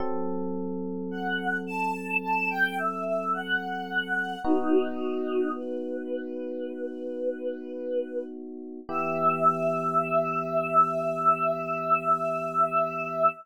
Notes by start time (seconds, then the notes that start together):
0.00 F#3 C4 A4
1.11 F#5
1.67 A5
2.22 A5
2.50 G5
2.78 E5
3.06 E5
3.33 F#5
4.44 B3 D#4 F#4
5.56 B4
8.89 E3 B3 G4 E5